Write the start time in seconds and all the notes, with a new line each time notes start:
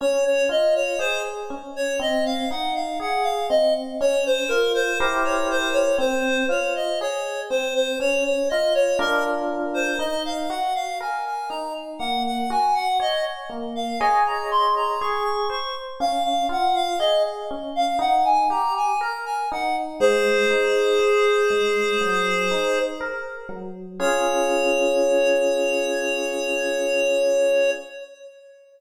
0.01 C#4 C#5
0.25 C#5
0.49 F4 D#5
0.75 C#5
0.99 G#4 C5
1.50 C#4
1.76 C#5
2.00 C4 D#5
2.25 F5
2.51 D#4 F#5
2.75 F5
3.00 G#4 F#5
3.23 F5
3.50 C4 D#5
4.00 C#4 C#5
4.26 C5
4.48 F4 A#4
4.74 C5
4.99 E4 G4 A#4 C5
5.25 C#5
5.50 C5
5.73 C#5
5.98 C4 C5
6.49 F4 C#5
6.75 D#5
7.01 G#4 C#5
7.50 C4 C5
7.75 C5
8.00 C#4 C#5
8.24 C#5
8.50 F4 D#5
8.75 C#5
8.99 D4 F4 A#4
9.74 C5
9.99 D#4 D#5
10.25 F5
10.50 F#4 F#5
10.75 F5
11.00 A#4 G#5
11.26 G#5
11.50 D#4 A#5
11.99 A#3 F#5
12.26 F#5
12.50 F#4 G#5
12.74 F#5
13.00 C#5 D#5
13.50 A#3
13.75 F5
14.00 G#4 C#5 D#5 G#5
14.26 A#5
14.51 C6
14.76 A#5
15.01 G#4 C#6
15.24 C#6
15.50 C5 C#6
16.00 C#4 F5
16.24 F5
16.49 F4 F#5
16.75 F5
16.99 G#4 D#5
17.51 C#4
17.76 F5
17.99 D#4 F#5
18.25 G#5
18.50 G4 A#5
18.77 G#5
19.01 A#4 A#5
19.26 G#5
19.52 D#4 F#5
20.00 G#3 G#4 C5
20.50 D#4
21.00 C5
21.50 G#3
22.01 F#3
22.51 D#4
23.00 A#4
23.49 F#3
24.00 C#4 F4 G#4 C#5